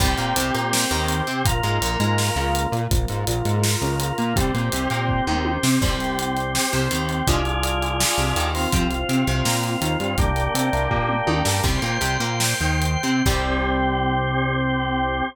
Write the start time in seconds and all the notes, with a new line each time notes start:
0.00 C2 G3 C4 G4, kick, crash
0.18 A#2 A#3, closed hi-hat
0.36 C2 C3, closed hi-hat
0.54 A#2 A#3, closed hi-hat
0.73 snare
0.91 D#2 D#3, closed hi-hat
1.08 closed hi-hat
1.27 C3 C4, closed hi-hat
1.45 A#1 A#3 F4, kick, closed hi-hat
1.63 G#2 G#3, closed hi-hat
1.82 A#1 A#2, closed hi-hat
2.00 G#2 G#3, closed hi-hat
2.18 snare
2.36 C#2 C#3, closed hi-hat
2.55 closed hi-hat
2.72 A#2 A#3, closed hi-hat
2.91 A#1 F3 A#3 F4, kick, closed hi-hat
3.08 G#2 G#3, closed hi-hat
3.27 A#1 A#2, closed hi-hat
3.45 G#2 G#3, closed hi-hat
3.63 snare
3.82 C#2 C#3, closed hi-hat
4.00 closed hi-hat
4.18 A#2 A#3, closed hi-hat
4.36 C2 G3 C4 G4, kick, closed hi-hat
4.54 A#2 A#3, closed hi-hat
4.72 C2 C3, closed hi-hat
4.90 A#2 A#3, closed hi-hat
5.09 kick
5.27 D#2 D#3, mid tom
5.45 high tom
5.63 C3 C4, snare
5.81 C2 G3 C4 G4, kick, crash
6.00 closed hi-hat
6.19 closed hi-hat
6.37 closed hi-hat
6.55 snare
6.73 C2 C3, closed hi-hat
6.91 D#2 D#3, closed hi-hat
7.09 closed hi-hat
7.27 C2 F3 G#3 D4 F4 G#4, kick, closed hi-hat
7.45 closed hi-hat
7.63 closed hi-hat
7.82 closed hi-hat
8.00 snare
8.18 C2 C3, closed hi-hat
8.36 D#2 D#3, closed hi-hat
8.55 C4 F4, open hi-hat
8.72 C2 F3 C4, kick, closed hi-hat
8.91 closed hi-hat
9.09 C3 C4, closed hi-hat
9.27 C2 C3, closed hi-hat
9.45 A#2 A#3, snare
9.64 closed hi-hat
9.81 D#2 D#3, closed hi-hat
10.00 G2 G3, closed hi-hat
10.18 C2 G3 A#3 D4 G4, kick, closed hi-hat
10.36 closed hi-hat
10.54 C3 C4, closed hi-hat
10.73 C2 C3, closed hi-hat
10.91 A#2 A#3, kick
11.09 mid tom
11.27 D#2 D#3, high tom
11.45 G2 G3, snare
11.63 C2 G3 C4 C5 G5, kick, crash
11.82 A#2 A#3, closed hi-hat
12.01 C2 C3, closed hi-hat
12.20 A#2 A#3, closed hi-hat
12.40 snare
12.60 D#2 D#3, closed hi-hat
12.82 closed hi-hat
13.03 C3 C4, closed hi-hat
13.26 C2 G3 C4 G4, kick, crash